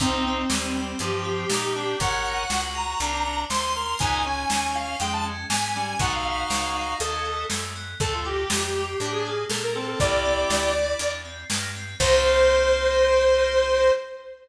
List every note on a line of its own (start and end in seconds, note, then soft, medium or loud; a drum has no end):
0.00 0.45 C2 medium
0.00 0.22 A#3 loud
0.00 0.42 C4 loud
0.00 0.25 C4 medium
0.00 0.42 D#4 loud
0.00 kick loud
0.00 closed hi-hat loud
0.25 0.74 C4 medium
0.25 0.49 C4 medium
0.49 0.95 D#2 medium
0.49 0.91 G3 medium
0.49 0.71 D#4 medium
0.49 snare loud
0.75 0.98 C4 medium
0.75 0.99 G4 medium
0.99 1.45 G2 medium
0.99 1.12 F3 loud
0.99 1.23 D#4 medium
0.99 1.98 G4 medium
0.99 closed hi-hat loud
1.12 1.24 F3 medium
1.23 1.45 F3 loud
1.23 1.46 C4 medium
1.49 1.95 A#2 medium
1.49 1.72 A#3 medium
1.49 1.72 D#4 medium
1.49 snare loud
1.75 1.98 C4 medium
1.75 1.96 D4 loud
1.99 2.45 G#1 medium
1.99 2.22 C#4 loud
1.99 2.43 A#4 loud
1.99 2.43 C#5 loud
1.99 2.61 F#5 medium
1.99 kick loud
1.99 closed hi-hat loud
2.25 2.47 D#4 medium
2.50 2.95 C#2 medium
2.50 2.73 F#4 medium
2.50 2.98 F#4 medium
2.50 snare loud
2.74 2.96 G#4 medium
2.74 3.41 A#5 medium
3.00 3.45 C2 medium
3.00 3.23 C4 loud
3.00 3.12 D4 medium
3.00 closed hi-hat loud
3.13 3.24 D4 medium
3.25 3.45 D4 medium
3.25 3.48 F#4 medium
3.50 3.95 D#2 medium
3.50 3.73 G#4 medium
3.50 3.73 C5 loud
3.50 3.98 C6 medium
3.50 snare loud
3.75 3.96 A#4 medium
3.75 3.98 A#4 medium
3.99 4.45 C#2 medium
3.99 4.21 B3 loud
3.99 4.23 D#4 loud
3.99 4.22 G#5 medium
3.99 kick loud
3.99 closed hi-hat loud
4.25 4.96 C#4 loud
4.25 4.48 C#4 medium
4.25 4.73 G#5 medium
4.50 4.95 D#2 medium
4.50 4.72 D#4 medium
4.50 snare loud
4.74 4.97 F4 medium
4.74 4.98 F5 medium
4.99 5.45 F2 medium
4.99 5.31 G#3 medium
4.99 5.22 D#4 medium
4.99 5.12 G5 medium
4.99 closed hi-hat loud
5.13 5.25 A5 medium
5.24 5.46 C#4 medium
5.50 5.95 G#2 medium
5.50 5.74 B3 medium
5.50 5.98 G#5 medium
5.50 snare loud
5.75 5.95 G3 medium
5.75 5.97 C#4 medium
5.99 6.44 B1 medium
5.99 6.24 A3 medium
5.99 6.94 D#4 medium
5.99 6.94 F#4 loud
5.99 6.12 F#5 medium
5.99 kick loud
5.99 closed hi-hat loud
6.12 6.24 F5 medium
6.24 6.46 B3 medium
6.24 6.71 F5 medium
6.50 6.95 C#2 medium
6.50 6.72 C#4 medium
6.50 snare loud
6.75 6.98 D#4 medium
6.75 6.96 F5 medium
7.00 7.45 D#2 medium
7.00 7.23 C#4 medium
7.00 7.45 A4 medium
7.00 7.42 D#5 medium
7.00 closed hi-hat loud
7.24 7.47 B3 medium
7.50 7.95 F#2 medium
7.50 7.74 A3 medium
7.50 snare loud
7.75 7.98 B3 medium
8.00 8.45 D2 medium
8.00 8.23 A3 loud
8.00 8.20 A4 loud
8.00 8.12 A4 medium
8.00 kick loud
8.00 closed hi-hat loud
8.13 8.25 F4 medium
8.24 8.47 A#3 medium
8.24 8.86 G4 medium
8.24 8.98 G4 medium
8.50 8.95 F2 medium
8.50 8.73 D4 medium
8.50 snare loud
8.75 8.98 F4 medium
9.00 9.45 A2 medium
9.00 9.30 D4 medium
9.00 9.24 D4 medium
9.00 9.12 G4 medium
9.00 closed hi-hat medium
9.12 9.44 G#4 medium
9.25 9.48 A#3 medium
9.50 9.95 A#2 medium
9.50 9.74 A3 medium
9.50 9.62 A4 medium
9.50 snare loud
9.63 9.75 A#4 medium
9.75 9.97 A#3 medium
9.75 9.99 C4 loud
9.75 9.87 A4 medium
9.88 9.99 A4 medium
10.00 10.45 C2 medium
10.00 10.22 A#3 loud
10.00 10.70 E4 loud
10.00 10.70 G4 loud
10.00 11.12 D5 medium
10.00 kick loud
10.00 closed hi-hat loud
10.24 10.47 C4 medium
10.50 10.95 D2 medium
10.50 10.73 D4 medium
10.50 snare loud
10.74 10.97 E4 medium
10.98 11.45 E2 medium
10.98 11.21 D4 medium
10.98 closed hi-hat loud
11.24 11.47 C4 medium
11.49 11.95 G2 medium
11.49 11.72 A#3 medium
11.49 snare loud
11.75 11.98 C4 medium
11.99 13.91 C2 loud
11.99 13.90 A#3 loud
11.99 13.90 C4 loud
11.99 13.90 D#4 medium
11.99 13.90 G4 loud
11.99 13.91 C5 loud
11.99 kick loud
11.99 crash loud